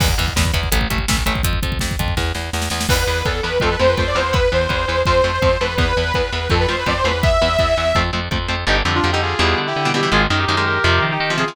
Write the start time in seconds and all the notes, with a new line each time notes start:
0.00 E2 E3 B3, kick, crash
0.08 kick
0.18 E2 E3 B3, kick, closed hi-hat
0.28 kick
0.36 E2 E3 B3, kick, snare
0.45 kick
0.53 E2 E3 B3, kick, closed hi-hat
0.63 kick
0.72 A1 E3 A3, kick, closed hi-hat
0.81 kick
0.90 A1 E3 A3, kick, closed hi-hat
0.98 kick
1.08 A1 E3 A3, kick, snare
1.17 kick
1.26 A1 E3 A3, kick, closed hi-hat
1.35 kick
1.43 F2, kick, closed hi-hat
1.53 kick
1.63 F2, kick, closed hi-hat
1.72 kick
1.79 F2, kick, snare
1.91 kick
1.99 F2, kick, closed hi-hat
2.08 kick
2.17 E2, kick, snare
2.35 E2, snare
2.53 E2, snare
2.62 snare
2.70 E2, snare
2.81 snare
2.89 E2 E3 B3 B4, kick, crash
3.07 E2 E3 B3
3.25 E2 E3 B3 A4, kick
3.43 E2 E3 B3 B4
3.60 F2 F3 A3 C4 A4, kick
3.71 B4
3.79 F2 F3 A3 C4 C5
3.89 B4
3.97 F2 F3 A3 C4 C5, kick
4.07 D5
4.15 E2 F3 A3 C4 C5
4.33 E3 B3 B4, kick
4.52 E2 E3 B3 C5
4.69 E2 E3 B3, kick
4.88 E2 E3 B3
5.05 F2 F3 A3 C4 C5, kick
5.24 F2 F3 A3 C4
5.33 C5
5.42 F2 F3 A3 C4, kick
5.61 F2 F3 A3 C4 B4
5.78 E2 E3 B3 B4, kick
5.97 E2 E3 B3
6.14 E2 E3 B3 B4, kick
6.32 E2 E3 B3 B4
6.50 F2 F3 A3 C4 A4, kick
6.60 B4
6.69 F2 F3 A3 C4 C5
6.79 B4
6.86 F2 F3 A3 C4 D5, kick
6.97 C5
7.04 E2 F3 A3 C4 B4
7.23 E3 B3 E5, kick
7.42 E2 E3 B3
7.59 E2 E3 B3, kick
7.77 E2 E3 B3
7.95 F2 F3 A3 C4, kick
8.13 F2 F3 A3 C4
8.31 F2 F3 A3 C4, kick
8.48 F2 F3 A3 C4
8.67 G1 D3 G3 D#4 G4
8.85 F2 D3 G3
8.95 D4 F4
9.04 F2 D3 G3
9.12 D3 G3 D#4 G4
9.22 F4 G#4
9.39 E2 B2 E3 G3
9.58 D3
9.67 E4 G4
9.76 D3
9.85 B2 E3 G3
9.94 B2 E3 G3 E4 G4
10.03 B2 E3 G3
10.12 G#1 D#3 G#3 F4 G#4
10.30 F#2 D#3 G#3
10.39 D#4 G4
10.48 F#2 D#3 G#3
10.56 D#3 G#3 G4 A#4
10.66 G4 A#4
10.84 F2 C3 F3
11.02 D#3
11.11 D#4 G4
11.20 D#3
11.30 C3 F3
11.38 C3 F3 F4 G#4
11.48 C3 F3